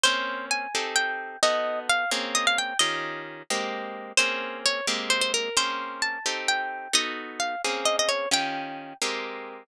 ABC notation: X:1
M:6/8
L:1/16
Q:3/8=87
K:Bbdor
V:1 name="Orchestral Harp"
c4 a4 g4 | ^d4 f2 z2 e f g2 | e4 z8 | c4 d2 z2 c c B2 |
c4 =a4 g4 | ^d4 f2 z2 e e _d2 | g6 z6 |]
V:2 name="Orchestral Harp"
[B,CDA]6 [CEG=A]6 | [=B,^D^F=A]6 [_B,C_D_A]6 | [E,DFG]6 [A,B,CG]6 | [B,CDA]6 [A,B,CG]6 |
[B,CDA]6 [CEG=A]6 | [=B,^D^F=A]6 [_B,C_D_A]6 | [E,DFG]6 [A,B,CG]6 |]